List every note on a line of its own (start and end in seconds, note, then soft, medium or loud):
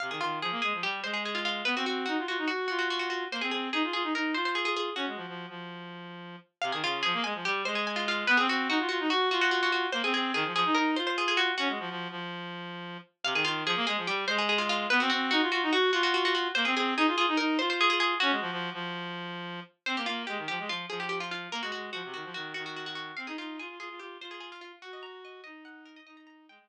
0.00 0.11 C3 medium
0.00 0.10 F5 loud
0.10 0.20 D#3 medium
0.10 0.21 G#4 medium
0.20 0.40 D#3 medium
0.20 0.39 F4 loud
0.41 0.51 F3 loud
0.41 0.61 G#4 medium
0.51 0.61 A#3 loud
0.62 0.73 G#3 medium
0.62 0.82 G#4 medium
0.73 0.83 F3 medium
0.83 1.02 G3 medium
0.83 1.00 G4 medium
1.03 1.62 G#3 loud
1.03 1.13 C5 medium
1.14 1.23 G#4 medium
1.25 1.35 G#4 medium
1.35 1.44 F4 medium
1.45 1.65 F4 loud
1.65 1.75 B3 loud
1.65 1.75 B4 loud
1.76 1.86 C4 loud
1.76 1.86 F#4 medium
1.86 2.06 C4 medium
1.86 2.05 F#4 medium
2.06 2.17 D#4 medium
2.06 2.24 F#4 medium
2.18 2.27 F4 medium
2.27 2.37 F4 medium
2.27 2.47 F#4 medium
2.38 2.48 D#4 medium
2.47 2.66 F#4 medium
2.47 2.67 F#4 medium
2.68 3.25 F4 loud
2.68 2.78 F#4 medium
2.79 2.88 F#4 medium
2.90 2.99 F#4 medium
2.99 3.09 F#4 medium
3.10 3.28 F#4 medium
3.31 3.41 A#3 loud
3.31 3.42 C5 loud
3.41 3.51 C4 loud
3.41 3.51 G#4 medium
3.51 3.70 C4 medium
3.51 3.69 G#4 medium
3.73 3.83 D#4 loud
3.73 3.92 G#4 medium
3.84 3.93 F4 medium
3.93 4.03 F4 loud
3.93 4.13 G#4 loud
4.03 4.13 D#4 medium
4.14 4.34 D#4 medium
4.14 4.32 A#4 medium
4.34 4.90 F4 medium
4.34 4.44 C5 medium
4.45 4.55 C5 medium
4.55 4.65 G#4 loud
4.65 4.75 G#4 loud
4.76 4.95 G#4 loud
4.96 5.06 C#4 loud
4.96 6.17 F#4 medium
5.07 5.17 G#3 medium
5.16 5.26 F3 medium
5.28 5.46 F3 medium
5.49 6.36 F3 medium
6.62 6.72 C3 loud
6.62 6.71 F5 loud
6.72 6.82 D#3 loud
6.72 6.82 G#4 medium
6.83 7.03 C#3 loud
6.83 7.02 F4 loud
7.03 7.14 F3 loud
7.03 7.23 G#4 loud
7.13 7.23 A#3 loud
7.24 7.34 G#3 loud
7.24 7.44 G#5 loud
7.34 7.44 F3 loud
7.45 7.64 G3 loud
7.45 7.62 G4 loud
7.65 8.24 G#3 loud
7.65 7.75 C5 loud
7.75 7.85 G#4 medium
7.87 7.97 G#5 medium
7.96 8.06 F4 loud
8.08 8.28 F4 loud
8.27 8.38 B3 loud
8.27 8.37 B4 loud
8.37 8.48 C4 loud
8.37 8.47 G#4 loud
8.48 8.68 C4 loud
8.48 8.69 F#4 loud
8.69 8.78 D#4 loud
8.69 8.88 F#4 loud
8.79 8.89 F4 loud
8.89 8.99 F4 loud
8.89 9.07 F#4 loud
9.00 9.10 D#4 loud
9.10 9.29 F#4 loud
9.31 9.86 F4 loud
9.31 9.41 F#4 loud
9.41 9.51 F#4 loud
9.51 9.61 F#4 loud
9.63 9.72 F#4 loud
9.72 9.91 F#4 medium
9.92 10.02 A#3 loud
9.92 10.02 C5 loud
10.04 10.13 C4 loud
10.04 10.13 G#4 loud
10.14 10.32 C4 loud
10.14 10.31 G#4 loud
10.34 10.44 D#3 loud
10.34 10.53 G#4 loud
10.45 10.54 F3 loud
10.54 10.64 F3 loud
10.54 10.76 G#4 loud
10.65 10.75 D#4 loud
10.75 10.96 D#4 loud
10.75 10.91 A#4 loud
10.96 11.51 F4 loud
10.96 11.06 C5 loud
11.07 11.17 C5 loud
11.18 11.27 G#4 loud
11.28 11.38 G#4 loud
11.37 11.55 F#4 loud
11.58 11.68 C#4 loud
11.58 12.20 F#4 loud
11.69 11.79 G#3 medium
11.79 11.89 F3 loud
11.90 12.08 F3 loud
12.10 12.97 F3 loud
13.24 13.34 C3 loud
13.24 13.34 F5 loud
13.34 13.44 D#3 loud
13.34 13.45 G#4 loud
13.44 13.64 D#3 loud
13.44 13.63 F4 loud
13.65 13.75 F3 loud
13.65 13.86 G#4 loud
13.76 13.86 A#3 loud
13.87 13.97 G#3 loud
13.87 14.07 G#4 loud
13.97 14.07 F3 loud
14.07 14.26 G3 loud
14.07 14.25 G4 loud
14.27 14.86 G#3 loud
14.27 14.37 C5 loud
14.38 14.48 G#4 loud
14.49 14.59 G#4 loud
14.58 14.68 F4 loud
14.69 14.89 F4 loud
14.90 15.00 B3 loud
14.90 15.00 B4 loud
15.00 15.10 C4 loud
15.00 15.09 F#4 loud
15.10 15.30 C4 loud
15.10 15.30 F#4 loud
15.31 15.41 D#4 loud
15.31 15.49 F#4 loud
15.41 15.51 F4 loud
15.52 15.62 F4 loud
15.52 15.70 F#4 loud
15.62 15.72 D#4 loud
15.72 15.91 F#4 loud
15.92 16.48 F4 loud
15.92 16.03 F#4 loud
16.03 16.13 F#4 loud
16.14 16.24 F#4 loud
16.25 16.34 F#4 loud
16.35 16.53 F#4 loud
16.55 16.65 A#3 loud
16.55 16.65 C5 loud
16.65 16.75 C4 loud
16.65 16.75 G#4 loud
16.76 16.94 C4 loud
16.76 16.94 G#4 loud
16.97 17.06 D#4 loud
16.97 17.17 G#4 loud
17.07 17.16 F4 loud
17.16 17.26 F4 loud
17.16 17.38 G#4 loud
17.28 17.37 D#4 loud
17.37 17.58 D#4 loud
17.37 17.54 A#4 loud
17.59 18.14 F4 loud
17.59 17.69 C5 loud
17.70 17.80 C5 loud
17.81 17.89 G#4 loud
17.90 17.99 G#4 loud
18.00 18.18 G#4 loud
18.20 18.31 C#4 loud
18.20 19.41 F#4 loud
18.31 18.41 G#3 loud
18.41 18.51 F3 loud
18.51 18.70 F3 loud
18.73 19.60 F3 loud
19.86 19.96 C4 loud
19.86 19.96 C5 loud
19.97 20.06 A#3 loud
19.97 20.07 G4 medium
20.06 20.25 A#3 loud
20.06 20.23 F4 loud
20.27 20.38 G#3 loud
20.27 20.44 G4 medium
20.37 20.47 D#3 medium
20.48 20.59 F3 loud
20.48 20.65 G4 loud
20.59 20.69 G#3 loud
20.69 20.86 F3 medium
20.69 20.86 F4 loud
20.89 21.48 F3 loud
20.89 20.99 G#4 medium
21.00 21.09 G4 medium
21.09 21.19 G4 loud
21.20 21.30 F4 loud
21.31 21.50 F4 medium
21.52 21.61 A#3 loud
21.52 21.62 A#4 loud
21.62 21.72 G#3 medium
21.62 21.71 F#4 loud
21.72 21.91 G#3 medium
21.72 21.90 F#4 medium
21.93 22.03 F3 loud
21.93 22.12 F#4 medium
22.04 22.14 C3 loud
22.14 22.24 D#3 medium
22.14 22.31 F#4 medium
22.24 22.34 F3 loud
22.34 22.53 D#3 loud
22.34 22.53 F#4 loud
22.54 23.12 D#3 loud
22.54 22.64 F#4 loud
22.66 22.76 F#4 medium
22.76 22.86 F#4 medium
22.86 22.95 F#4 loud
22.95 23.15 F#4 loud
23.17 23.27 C4 loud
23.17 23.26 F5 loud
23.27 23.37 D#4 loud
23.27 23.37 G#4 medium
23.38 23.58 D#4 medium
23.38 23.57 F4 loud
23.59 23.68 F4 loud
23.59 23.76 G#4 medium
23.69 23.79 F4 medium
23.79 23.89 F4 loud
23.79 23.99 G#4 loud
23.89 23.99 F4 medium
23.99 24.17 F4 medium
23.99 24.18 G4 medium
24.21 24.72 F4 loud
24.21 24.31 C5 loud
24.31 24.40 G#4 medium
24.40 24.50 G#4 medium
24.52 24.61 F4 medium
24.61 24.79 F4 medium
24.82 24.92 F#4 loud
24.82 25.41 F#4 loud
24.93 25.03 D#5 medium
25.03 25.21 A#5 loud
25.25 25.43 D#5 medium
25.44 25.99 D#4 loud
25.44 25.64 D#5 loud
25.65 25.84 F#5 loud
25.85 25.95 A#4 medium
25.96 26.06 D#5 loud
26.06 26.47 D#4 loud
26.06 26.16 D#5 loud
26.17 26.26 A#5 loud
26.27 26.45 A#5 loud
26.48 26.58 G#3 loud
26.48 26.67 G5 loud
26.59 26.69 G#3 medium